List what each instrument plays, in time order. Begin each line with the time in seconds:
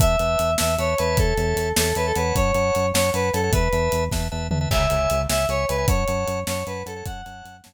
0.00 synth bass 1 E2, drawbar organ B4 E5 A5, lead 1 (square) E5, kick, closed hi-hat
0.19 synth bass 1 E2, drawbar organ B4 E5 A5, closed hi-hat
0.39 synth bass 1 E2, closed hi-hat
0.58 synth bass 1 E2, drawbar organ B4 E5 A5, lead 1 (square) E5, snare
0.78 synth bass 1 E2, drawbar organ B4 E5 A5, lead 1 (square) C#5, closed hi-hat
0.98 synth bass 1 E2, lead 1 (square) B4, drawbar organ C#5 E5 A5, closed hi-hat
1.17 synth bass 1 E2, lead 1 (square) A4, kick, closed hi-hat
1.37 synth bass 1 E2, drawbar organ C#5 E5 A5, closed hi-hat
1.56 synth bass 1 E2, closed hi-hat
1.76 synth bass 1 E2, lead 1 (square) A4, drawbar organ C#5 E5 A5, snare
1.95 synth bass 1 E2, lead 1 (square) B4, drawbar organ C#5 E5 A5, closed hi-hat
2.06 lead 1 (square) A4
2.16 synth bass 1 E2, lead 1 (square) B4, drawbar organ C#5 F#5 A5, closed hi-hat
2.36 synth bass 1 F#2, lead 1 (square) C#5, kick, closed hi-hat
2.54 synth bass 1 F#2, drawbar organ C#5 F#5 A5, closed hi-hat
2.75 synth bass 1 F#2, closed hi-hat
2.94 synth bass 1 F#2, drawbar organ C#5 F#5 A5, lead 1 (square) C#5, snare
3.13 synth bass 1 F#2, lead 1 (square) B4, drawbar organ C#5 F#5 A5, closed hi-hat
3.33 synth bass 1 F#2, lead 1 (square) A4, drawbar organ C#5 F#5 A5, closed hi-hat
3.43 drawbar organ C#5 F#5 A5
3.52 synth bass 1 E2, drawbar organ B4 E5 A5, lead 1 (square) B4, kick, closed hi-hat
3.72 synth bass 1 E2, drawbar organ B4 E5 A5, closed hi-hat
3.92 synth bass 1 E2, closed hi-hat
4.11 synth bass 1 E2, drawbar organ B4 E5 A5, kick, snare
4.32 synth bass 1 E2, drawbar organ B4 E5 A5
4.51 synth bass 1 E2, drawbar organ B4 E5 A5, floor tom
4.61 drawbar organ B4 E5 A5
4.71 synth bass 1 C#2, drawbar organ C#5 E5 G#5, lead 1 (square) E5, kick, crash
4.90 synth bass 1 C#2, drawbar organ C#5 E5 G#5, closed hi-hat
5.10 synth bass 1 C#2, closed hi-hat
5.29 synth bass 1 C#2, drawbar organ C#5 E5 G#5, lead 1 (square) E5, snare
5.49 synth bass 1 C#2, lead 1 (square) C#5, drawbar organ C#5 E5 G#5, closed hi-hat
5.69 synth bass 1 C#2, lead 1 (square) B4, drawbar organ C#5 E5 G#5, closed hi-hat
5.78 drawbar organ C#5 E5 G#5
5.88 synth bass 1 F#2, drawbar organ C#5 F#5 A5, lead 1 (square) C#5, kick, closed hi-hat
6.08 synth bass 1 F#2, drawbar organ C#5 F#5 A5, closed hi-hat
6.27 synth bass 1 F#2, closed hi-hat
6.47 synth bass 1 F#2, lead 1 (square) C#5, drawbar organ C#5 F#5 A5, snare
6.66 synth bass 1 F#2, lead 1 (square) B4, drawbar organ C#5 F#5 A5, closed hi-hat
6.86 synth bass 1 F#2, lead 1 (square) A4, drawbar organ C#5 F#5 A5, closed hi-hat
6.96 drawbar organ C#5 F#5 A5
7.06 synth bass 1 F#2, drawbar organ C#5 F#5 A5, lead 1 (square) F#5, kick, closed hi-hat
7.25 synth bass 1 F#2, drawbar organ C#5 F#5 A5, closed hi-hat
7.45 synth bass 1 F#2, closed hi-hat
7.64 synth bass 1 F#2, drawbar organ C#5 F#5 A5, snare